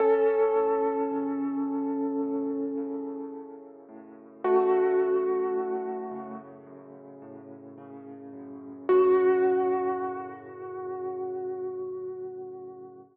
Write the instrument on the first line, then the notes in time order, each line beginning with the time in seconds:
acoustic grand piano
0.00 F#2 C#4 A4
0.56 A2
1.11 C#3
1.67 F#2
2.22 A2
2.77 C#3
3.34 F#2
3.89 A2
4.44 C#3 A3 F#4
5.00 F#2
5.56 A2
6.11 C#3
6.66 F#2
7.22 A2
7.78 C#3
8.33 F#2
8.89 F#2 A2 C#3 F#4